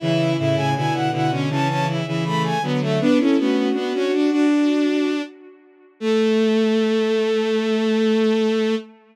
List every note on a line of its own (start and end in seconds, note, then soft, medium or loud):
0.00 0.34 C#3 medium
0.00 0.34 E3 loud
0.00 0.37 E4 medium
0.00 0.32 E5 loud
0.37 0.55 A2 medium
0.37 0.55 C#3 medium
0.37 0.69 E4 medium
0.37 0.56 E5 loud
0.56 0.74 A2 medium
0.56 0.74 C#3 medium
0.56 0.74 G#5 loud
0.75 0.92 B2 medium
0.75 0.92 D3 medium
0.75 1.09 E4 medium
0.75 0.93 G#5 loud
0.93 1.10 B2 medium
0.93 1.10 D3 medium
0.93 1.11 F#5 loud
1.11 1.29 B2 medium
1.11 1.29 D3 medium
1.11 1.30 E4 medium
1.11 1.31 F#5 loud
1.30 1.48 B2 medium
1.30 1.48 D3 medium
1.30 1.49 C#4 medium
1.50 2.01 C#3 medium
1.50 2.01 E3 loud
1.50 1.68 C#4 medium
1.50 1.68 A5 loud
1.68 1.87 C#4 medium
1.68 1.86 A5 loud
1.88 2.05 E4 medium
2.06 2.52 C#3 medium
2.06 2.52 E3 medium
2.06 2.24 E4 medium
2.24 2.58 A3 medium
2.24 2.42 B5 loud
2.44 2.62 G#5 loud
2.62 2.98 D3 medium
2.62 2.98 F#3 loud
2.62 2.80 B3 medium
2.81 2.99 A3 medium
2.81 3.00 E5 medium
3.00 3.18 B3 loud
3.00 3.18 D4 loud
3.00 3.18 B4 loud
3.18 3.36 C#4 medium
3.18 3.37 C#4 medium
3.18 3.37 E4 medium
3.18 3.38 A4 loud
3.37 3.71 A3 medium
3.37 3.69 B3 medium
3.37 3.71 C#4 medium
3.37 3.56 F#4 loud
3.56 4.46 F#4 loud
3.73 3.91 B3 medium
3.73 3.93 B3 medium
3.73 3.91 D4 loud
3.94 4.12 C#4 medium
3.94 4.29 D4 medium
3.94 4.29 F#4 medium
4.12 4.30 D4 medium
4.30 5.10 D4 medium
4.30 5.22 D4 loud
4.30 5.10 F#4 medium
6.00 8.75 A3 loud
6.00 8.76 A3 loud
6.00 8.75 A4 loud